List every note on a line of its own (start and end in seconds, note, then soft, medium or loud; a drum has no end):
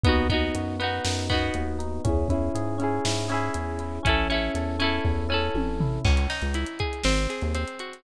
0.04 0.50 D#2 medium
0.04 0.28 B3 loud
0.04 0.80 B3 loud
0.04 0.28 D#4 loud
0.04 kick loud
0.04 closed hi-hat loud
0.09 0.28 F#4 loud
0.29 0.76 B3 medium
0.29 1.04 D#4 medium
0.29 0.76 D#4 loud
0.29 kick medium
0.29 closed hi-hat medium
0.34 0.76 F#4 loud
0.55 1.00 F#2 medium
0.55 1.29 F#4 medium
0.55 closed hi-hat loud
0.80 1.26 B3 loud
0.80 1.55 B3 medium
0.80 1.26 D#4 medium
0.80 closed hi-hat medium
0.84 1.26 F#4 loud
1.04 1.50 F#2 medium
1.04 1.78 D#4 medium
1.04 snare loud
1.29 1.99 B3 loud
1.29 1.99 D#4 medium
1.29 2.01 F#4 medium
1.29 kick medium
1.29 closed hi-hat medium
1.34 1.99 F#4 loud
1.54 2.00 D#2 medium
1.54 2.03 B3 medium
1.54 closed hi-hat medium
1.79 2.03 D#4 medium
1.79 closed hi-hat medium
2.04 2.50 E2 medium
2.04 2.78 C#4 loud
2.04 2.28 C#4 loud
2.04 2.28 E4 loud
2.04 kick loud
2.04 closed hi-hat loud
2.09 2.28 G#4 loud
2.29 2.76 C#4 loud
2.29 3.05 E4 medium
2.29 2.76 E4 loud
2.29 kick medium
2.29 closed hi-hat medium
2.34 2.76 G#4 medium
2.55 3.00 G#2 medium
2.55 3.28 G#4 medium
2.55 closed hi-hat loud
2.78 3.54 C#4 medium
2.78 3.26 C#4 medium
2.78 3.26 E4 loud
2.78 closed hi-hat medium
2.84 3.26 G#4 loud
3.05 3.50 G#2 medium
3.05 3.79 E4 loud
3.05 snare loud
3.28 3.99 C#4 loud
3.28 3.99 E4 loud
3.28 4.00 G#4 medium
3.28 closed hi-hat medium
3.34 3.99 G#4 loud
3.54 4.00 E2 medium
3.54 4.02 C#4 medium
3.54 closed hi-hat loud
3.79 4.04 E4 medium
3.79 closed hi-hat medium
4.03 4.50 A1 medium
4.03 4.78 C#4 loud
4.03 4.28 C#4 loud
4.03 4.28 E4 loud
4.03 kick medium
4.03 closed hi-hat loud
4.09 4.28 A4 loud
4.30 4.76 C#4 medium
4.30 5.04 E4 medium
4.30 4.76 E4 loud
4.30 closed hi-hat medium
4.34 4.76 A4 medium
4.55 5.00 E2 medium
4.55 5.28 A4 medium
4.55 closed hi-hat loud
4.79 5.54 C#4 medium
4.79 5.26 C#4 loud
4.79 5.26 E4 loud
4.79 closed hi-hat medium
4.84 5.26 A4 medium
5.04 5.49 E2 medium
5.04 5.80 E4 medium
5.04 kick medium
5.29 5.99 C#4 medium
5.29 5.99 E4 loud
5.29 6.00 A4 medium
5.34 5.99 A4 loud
5.54 6.00 A1 medium
5.54 6.02 C#4 medium
5.54 high tom medium
5.80 6.04 E4 medium
5.80 floor tom loud
6.05 6.27 C#2 loud
6.05 7.00 C#4 loud
6.05 kick loud
6.05 crash loud
6.17 closed hi-hat medium
6.30 7.01 D#4 medium
6.30 snare medium
6.30 closed hi-hat medium
6.42 6.65 C#2 medium
6.42 closed hi-hat medium
6.54 7.02 E4 medium
6.54 closed hi-hat loud
6.66 closed hi-hat medium
6.79 7.04 G#4 medium
6.79 kick medium
6.79 closed hi-hat medium
6.93 closed hi-hat medium
7.04 7.27 G#1 loud
7.04 7.54 C4 loud
7.04 snare loud
7.18 closed hi-hat medium
7.30 8.01 G#4 medium
7.30 closed hi-hat medium
7.42 7.65 D#2 medium
7.42 closed hi-hat medium
7.55 8.02 C4 medium
7.55 closed hi-hat loud
7.68 closed hi-hat medium
7.79 8.04 F#4 medium
7.79 closed hi-hat medium
7.93 closed hi-hat medium